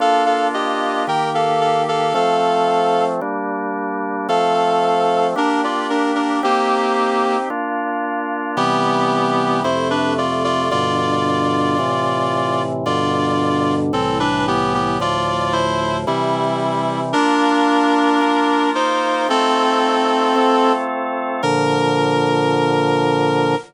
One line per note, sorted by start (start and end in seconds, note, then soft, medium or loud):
0.00 1.06 A#3 medium
0.00 1.06 D4 medium
0.00 1.06 F4 medium
0.00 0.23 A4 medium
0.00 0.23 F5 medium
0.26 0.47 A4 medium
0.26 0.47 F5 medium
0.54 1.03 G4 medium
0.54 1.03 D#5 medium
1.07 2.13 D#3 medium
1.07 2.13 A#3 medium
1.07 2.13 G4 medium
1.07 1.30 A#4 medium
1.07 1.30 G5 medium
1.34 1.60 A4 medium
1.34 1.60 F5 medium
1.61 1.82 A4 medium
1.61 1.82 F5 medium
1.88 2.13 A4 medium
1.88 2.13 F5 medium
2.14 3.20 F3 medium
2.14 3.20 A3 medium
2.14 3.20 C4 medium
2.14 3.04 A4 medium
2.14 3.04 F5 medium
3.21 4.27 G3 medium
3.21 4.27 A#3 medium
3.21 4.27 D4 medium
4.29 5.35 F3 medium
4.29 5.35 A3 medium
4.29 5.35 C4 medium
4.29 5.27 A4 medium
4.29 5.27 F5 medium
5.36 6.42 A#3 medium
5.36 6.42 D4 medium
5.36 5.61 D4 medium
5.36 6.42 G4 medium
5.36 5.61 A#4 medium
5.64 5.87 F4 medium
5.64 5.87 D5 medium
5.90 6.12 D4 medium
5.90 6.12 A#4 medium
6.15 6.40 D4 medium
6.15 6.40 A#4 medium
6.43 7.37 A#3 medium
6.43 7.49 C4 medium
6.43 7.49 D#4 medium
6.43 7.49 G4 medium
6.43 7.37 G4 medium
7.50 8.56 A#3 medium
7.50 8.56 D4 medium
7.50 8.56 F4 medium
8.57 9.63 C3 medium
8.57 9.63 E3 medium
8.57 9.63 G3 medium
8.57 9.61 B3 medium
8.57 9.61 G4 medium
9.64 10.70 F2 medium
9.64 10.70 C3 medium
9.64 10.70 A3 medium
9.64 9.88 E4 medium
9.64 9.88 C5 medium
9.90 10.13 D4 medium
9.90 10.13 B4 medium
10.18 10.43 F4 medium
10.18 10.43 D5 medium
10.44 10.68 F4 medium
10.44 10.68 D5 medium
10.71 11.77 G2 medium
10.71 11.77 B2 medium
10.71 11.77 D3 medium
10.71 12.62 F4 medium
10.71 12.62 D5 medium
11.79 12.85 A2 medium
11.79 12.85 C3 medium
11.79 12.85 E3 medium
12.86 13.92 G2 loud
12.86 13.92 B2 medium
12.86 13.92 D3 loud
12.86 13.75 F4 medium
12.86 13.75 D5 medium
13.93 14.99 C2 medium
13.93 14.99 A2 medium
13.93 14.99 E3 medium
13.93 14.18 C4 medium
13.93 14.18 A4 medium
14.20 14.45 D4 medium
14.20 14.45 B4 medium
14.47 14.73 B3 medium
14.47 14.73 G4 medium
14.74 14.98 B3 medium
14.74 14.98 G4 medium
15.00 16.06 D2 medium
15.00 16.06 A2 medium
15.00 16.06 F3 medium
15.00 15.53 F4 medium
15.00 15.53 D5 medium
15.53 15.97 E4 medium
15.53 15.97 C5 medium
16.07 17.13 C3 loud
16.07 17.13 E3 medium
16.07 17.01 G3 medium
16.07 17.13 G3 medium
16.07 17.01 E4 medium
17.13 18.20 A#3 medium
17.13 18.70 D4 medium
17.13 18.20 D4 medium
17.13 18.20 F4 medium
17.13 18.70 A#4 medium
18.21 19.28 A#3 medium
18.21 19.28 F4 medium
18.21 19.28 A#4 medium
18.75 19.27 D#4 medium
18.75 19.27 C5 medium
19.29 20.35 A3 medium
19.29 20.35 C4 medium
19.29 20.72 C4 medium
19.29 20.35 D#4 medium
19.29 20.35 F4 medium
19.29 20.72 A4 medium
20.36 21.42 A3 medium
20.36 21.42 C4 medium
20.36 21.42 F4 medium
20.36 21.42 A4 medium
21.43 23.55 A#2 medium
21.43 23.55 D3 loud
21.43 23.55 F3 loud
21.43 23.55 A#4 loud